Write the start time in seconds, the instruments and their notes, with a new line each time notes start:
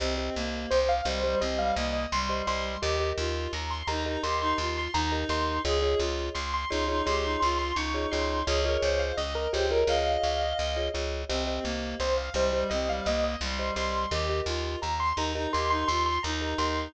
0.00 electric bass (finger) C2, clarinet C4, marimba G4 C5 D#5
0.18 marimba G4 C5 D#5
0.35 electric bass (finger) C2, clarinet A#3
0.71 electric bass (finger) C2, acoustic grand piano C5
0.89 acoustic grand piano F5
1.05 electric bass (finger) C2, clarinet G3, marimba G4 C5 D#5, acoustic grand piano C5
1.24 clarinet G3, marimba G4 C5 D#5
1.41 electric bass (finger) C2, clarinet C4, marimba G4 C5 D#5, acoustic grand piano D#5
1.59 clarinet G3, acoustic grand piano F5
1.76 electric bass (finger) C2, clarinet A#3, acoustic grand piano D#5
1.93 acoustic grand piano D#5
2.12 electric bass (finger) C2, clarinet G3, acoustic grand piano C6
2.29 marimba G4 C5 D#5
2.47 electric bass (finger) C2, marimba G4 C5 D#5, acoustic grand piano C6
2.81 electric bass (finger) D#2, clarinet G4, marimba G4 A#4 D#5
3.00 marimba G4 A#4 D#5
3.17 electric bass (finger) D#2, clarinet F4
3.53 electric bass (finger) D#2, acoustic grand piano A#5
3.71 acoustic grand piano C6
3.87 electric bass (finger) D#2, clarinet D#4, marimba G4 A#4 D#5, acoustic grand piano A#5
4.06 clarinet D#4, marimba G4 A#4 D#5
4.23 electric bass (finger) D#2, clarinet G4, marimba G4 A#4 D#5, acoustic grand piano C6
4.41 clarinet D#4, acoustic grand piano C6
4.58 electric bass (finger) D#2, clarinet F4, acoustic grand piano C6
4.77 acoustic grand piano C6
4.94 electric bass (finger) D#2, clarinet D#4, acoustic grand piano A#5
5.12 marimba G4 A#4 D#5
5.29 electric bass (finger) D#2, marimba G4 A#4 D#5, acoustic grand piano C6
5.65 electric bass (finger) C#2, marimba F4 G#4 C#5 D#5, clarinet G#4
5.82 marimba F4 G#4 C#5 D#5
5.99 electric bass (finger) C#2, clarinet F4
6.35 electric bass (finger) C#2, acoustic grand piano C6
6.54 acoustic grand piano C6
6.70 electric bass (finger) C#2, clarinet D#4, marimba F4 G#4 C#5 D#5, acoustic grand piano C6
6.88 clarinet D#4, marimba F4 G#4 C#5 D#5
7.06 electric bass (finger) C#2, marimba F4 G#4 C#5 D#5, clarinet G4, acoustic grand piano C6
7.24 clarinet D#4, acoustic grand piano C6
7.40 electric bass (finger) C#2, clarinet F4, acoustic grand piano C6
7.59 acoustic grand piano C6
7.75 electric bass (finger) C#2, clarinet D#4, acoustic grand piano C#6
7.94 marimba F4 G#4 C#5 D#5
8.11 electric bass (finger) C#2, marimba F4 G#4 C#5 D#5, acoustic grand piano C6
8.47 electric bass (finger) C#2, marimba F4 G#4 C#5 D#5, clarinet G#4, acoustic grand piano C#5
8.64 marimba F4 G#4 C#5 D#5, clarinet A#4
8.82 electric bass (finger) C#2, clarinet C5
8.99 acoustic grand piano F5
9.17 electric bass (finger) C#2, clarinet D#5, acoustic grand piano D#5
9.35 acoustic grand piano A#4
9.53 electric bass (finger) C#2, marimba F4 G#4 C#5 D#5, acoustic grand piano G4, clarinet C5
9.71 marimba F4 G#4 C#5 D#5, acoustic grand piano A#4
9.87 electric bass (finger) C#2, marimba F4 G#4 C#5 D#5, clarinet D#5, acoustic grand piano F5
10.23 electric bass (finger) C#2
10.59 electric bass (finger) C#2
10.76 marimba F4 G#4 C#5 D#5
10.94 electric bass (finger) C#2, marimba F4 G#4 C#5 D#5
11.29 electric bass (finger) C2, clarinet C4, marimba G4 C5 D#5
11.47 marimba G4 C5 D#5
11.63 electric bass (finger) C2, clarinet A#3
12.00 electric bass (finger) C2, acoustic grand piano C5
12.18 acoustic grand piano F5
12.34 electric bass (finger) C2, clarinet G3, marimba G4 C5 D#5, acoustic grand piano C5
12.53 clarinet G3, marimba G4 C5 D#5
12.70 electric bass (finger) C2, clarinet C4, marimba G4 C5 D#5, acoustic grand piano D#5
12.89 clarinet G3, acoustic grand piano F5
13.06 electric bass (finger) C2, clarinet A#3, acoustic grand piano D#5
13.24 acoustic grand piano D#5
13.41 electric bass (finger) C2, clarinet G3, acoustic grand piano C6
13.59 marimba G4 C5 D#5
13.76 electric bass (finger) C2, marimba G4 C5 D#5, acoustic grand piano C6
14.11 electric bass (finger) D#2, clarinet G4, marimba G4 A#4 D#5
14.29 marimba G4 A#4 D#5
14.46 electric bass (finger) D#2, clarinet F4
14.82 electric bass (finger) D#2, acoustic grand piano A#5
15.00 acoustic grand piano C6
15.16 electric bass (finger) D#2, clarinet D#4, marimba G4 A#4 D#5, acoustic grand piano A#5
15.35 clarinet D#4, marimba G4 A#4 D#5
15.53 electric bass (finger) D#2, marimba G4 A#4 D#5, clarinet G4, acoustic grand piano C6
15.70 clarinet D#4, acoustic grand piano C6
15.88 electric bass (finger) D#2, clarinet F4, acoustic grand piano C6
16.06 acoustic grand piano C6
16.23 electric bass (finger) D#2, clarinet D#4, acoustic grand piano A#5
16.41 marimba G4 A#4 D#5
16.58 electric bass (finger) D#2, marimba G4 A#4 D#5, acoustic grand piano C6